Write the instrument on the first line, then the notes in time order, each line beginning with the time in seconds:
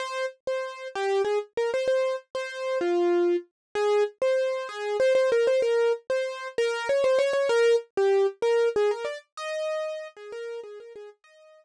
acoustic grand piano
0.00 C5
0.47 C5
0.95 G4
1.25 G#4
1.57 A#4
1.74 C5
1.88 C5
2.35 C5
2.81 F4
3.75 G#4
4.22 C5
4.69 G#4
5.00 C5
5.15 C5
5.32 A#4
5.47 C5
5.62 A#4
6.10 C5
6.58 A#4
6.89 C#5
7.04 C5
7.19 C#5
7.33 C#5
7.49 A#4
7.97 G4
8.42 A#4
8.76 G#4
8.91 A#4
9.05 D5
9.37 D#5
10.17 G#4
10.32 A#4
10.63 G#4
10.80 A#4
10.96 G#4
11.24 D#5